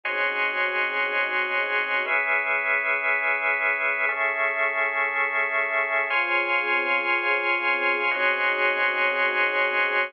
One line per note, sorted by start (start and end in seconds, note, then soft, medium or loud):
0.04 2.03 C#3 medium
0.04 2.03 C4 medium
0.04 2.03 D#4 medium
0.04 2.03 F#4 medium
0.04 2.03 G#4 medium
0.04 2.05 C#5 medium
0.04 2.05 D#5 medium
0.04 2.05 G#5 medium
0.04 2.05 C6 medium
0.04 2.05 F#6 medium
2.06 4.05 C#4 medium
2.06 4.05 G#4 medium
2.06 4.05 B4 medium
2.06 4.05 E5 medium
4.09 6.08 A3 medium
4.09 6.08 C#4 medium
4.09 6.08 G#4 medium
4.09 6.08 E5 medium
6.10 8.10 C#3 medium
6.10 8.10 C4 loud
6.10 8.10 F4 loud
6.10 8.10 G#4 loud
6.10 8.10 C#5 medium
6.10 8.10 G#5 loud
6.10 8.10 C6 loud
6.10 8.10 F6 medium
8.10 10.10 C#3 loud
8.10 10.10 C4 loud
8.10 10.10 D#4 loud
8.10 10.10 F#4 loud
8.10 10.10 G#4 loud
8.10 10.11 C#5 medium
8.10 10.11 D#5 medium
8.10 10.11 G#5 medium
8.10 10.11 C6 medium
8.10 10.11 F#6 medium